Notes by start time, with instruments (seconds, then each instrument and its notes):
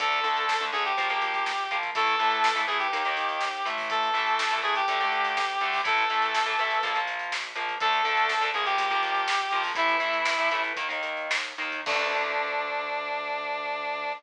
0.00 synth bass 1 D2, overdriven guitar D3 A3, lead 1 (square) A4, kick, closed hi-hat
0.12 closed hi-hat
0.24 synth bass 1 D2, overdriven guitar D3 A3, closed hi-hat
0.36 closed hi-hat
0.49 synth bass 1 D2, snare
0.60 overdriven guitar D3 A3, closed hi-hat
0.72 synth bass 1 D2, overdriven guitar D3 A3, lead 1 (square) G#4, closed hi-hat
0.85 lead 1 (square) G4, closed hi-hat
0.97 synth bass 1 A#1, overdriven guitar F3 A#3, kick, closed hi-hat
1.09 overdriven guitar F3 A#3, closed hi-hat
1.22 synth bass 1 A#1, closed hi-hat
1.34 kick, closed hi-hat
1.46 synth bass 1 A#1, snare
1.58 closed hi-hat
1.71 synth bass 1 A#1, overdriven guitar F3 A#3, closed hi-hat
1.83 kick, closed hi-hat
1.95 synth bass 1 A1, overdriven guitar E3 A3, lead 1 (square) A4, kick, closed hi-hat
2.07 kick, closed hi-hat
2.19 synth bass 1 A1, overdriven guitar E3 A3, closed hi-hat
2.31 closed hi-hat
2.44 synth bass 1 A1, snare
2.55 overdriven guitar E3 A3, closed hi-hat
2.67 synth bass 1 A1, overdriven guitar E3 A3, lead 1 (square) G#4, closed hi-hat
2.79 lead 1 (square) G4, closed hi-hat
2.93 synth bass 1 D#2, overdriven guitar D#3 A#3, kick, closed hi-hat
3.05 overdriven guitar D#3 A#3, closed hi-hat
3.17 synth bass 1 D#2, closed hi-hat
3.29 closed hi-hat
3.41 synth bass 1 D#2, snare
3.54 closed hi-hat
3.65 synth bass 1 A1, overdriven guitar E3 A3, closed hi-hat
3.78 kick, open hi-hat
3.90 lead 1 (square) A4, kick, closed hi-hat
4.03 closed hi-hat
4.14 synth bass 1 A1, overdriven guitar E3 A3, closed hi-hat
4.27 closed hi-hat
4.39 synth bass 1 A1, snare
4.51 overdriven guitar E3 A3, closed hi-hat
4.62 synth bass 1 A1, overdriven guitar E3 A3, lead 1 (square) G#4, closed hi-hat
4.75 lead 1 (square) G4, closed hi-hat
4.88 synth bass 1 D2, overdriven guitar D3 A3, kick, closed hi-hat
5.00 overdriven guitar D3 A3, closed hi-hat
5.12 synth bass 1 D2, closed hi-hat
5.24 kick, closed hi-hat
5.37 synth bass 1 D2, snare
5.49 closed hi-hat
5.60 synth bass 1 D2, overdriven guitar D3 A3, closed hi-hat
5.73 kick, open hi-hat
5.84 synth bass 1 A1, overdriven guitar E3 A3, lead 1 (square) A4, kick, closed hi-hat
5.98 kick, closed hi-hat
6.10 synth bass 1 A1, overdriven guitar E3 A3, closed hi-hat
6.22 closed hi-hat
6.34 synth bass 1 A1, snare
6.46 overdriven guitar E3 A3, closed hi-hat
6.59 synth bass 1 A1, overdriven guitar E3 A3, closed hi-hat
6.71 closed hi-hat
6.83 synth bass 1 A#1, overdriven guitar F3 A#3, kick, closed hi-hat
6.94 overdriven guitar F3 A#3, closed hi-hat
7.07 synth bass 1 A#1, closed hi-hat
7.19 closed hi-hat
7.32 synth bass 1 A#1, snare
7.44 closed hi-hat
7.55 synth bass 1 A#1, overdriven guitar F3 A#3, closed hi-hat
7.68 kick, closed hi-hat
7.80 synth bass 1 D2, overdriven guitar D3 A3, lead 1 (square) A4, kick, closed hi-hat
7.93 closed hi-hat
8.05 synth bass 1 D2, overdriven guitar D3 A3, closed hi-hat
8.17 closed hi-hat
8.29 synth bass 1 D2, snare
8.41 overdriven guitar D3 A3, closed hi-hat
8.54 synth bass 1 D2, overdriven guitar F3 A#3, lead 1 (square) G#4, closed hi-hat
8.65 lead 1 (square) G4, closed hi-hat
8.78 synth bass 1 A#1, kick, closed hi-hat
8.90 overdriven guitar F3 A#3, closed hi-hat
9.02 synth bass 1 A#1, closed hi-hat
9.14 kick, closed hi-hat
9.27 synth bass 1 A#1, snare
9.39 closed hi-hat
9.51 synth bass 1 A#1, overdriven guitar F3 A#3, closed hi-hat
9.63 kick, open hi-hat
9.75 synth bass 1 A1, overdriven guitar E3 A3, lead 1 (square) E4, kick, closed hi-hat
9.87 kick, closed hi-hat
10.00 synth bass 1 A1, overdriven guitar E3 A3, closed hi-hat
10.13 closed hi-hat
10.25 synth bass 1 A1, snare
10.38 overdriven guitar E3 A3, closed hi-hat
10.51 synth bass 1 A1, overdriven guitar E3 A3, closed hi-hat
10.64 closed hi-hat
10.76 synth bass 1 D#2, overdriven guitar D#3 A#3, kick, closed hi-hat
10.89 overdriven guitar D#3 A#3, closed hi-hat
11.03 synth bass 1 D#2, closed hi-hat
11.17 closed hi-hat
11.30 synth bass 1 D#2, snare
11.44 closed hi-hat
11.58 synth bass 1 D#2, overdriven guitar D#3 A#3, closed hi-hat
11.72 kick, closed hi-hat
11.86 synth bass 1 D2, overdriven guitar D3 A3, lead 1 (square) D4, kick, crash